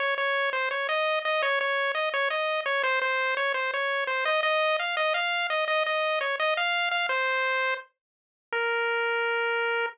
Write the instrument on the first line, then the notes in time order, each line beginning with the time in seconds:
lead 1 (square)
0.00 C#5
0.18 C#5
0.53 C5
0.71 C#5
0.89 D#5
1.25 D#5
1.42 C#5
1.61 C#5
1.95 D#5
2.14 C#5
2.30 D#5
2.66 C#5
2.83 C5
3.02 C5
3.37 C#5
3.54 C5
3.74 C#5
4.07 C5
4.25 D#5
4.43 D#5
4.79 F5
4.97 D#5
5.14 F5
5.50 D#5
5.68 D#5
5.86 D#5
6.21 C#5
6.40 D#5
6.57 F5
6.91 F5
7.09 C5
8.52 A#4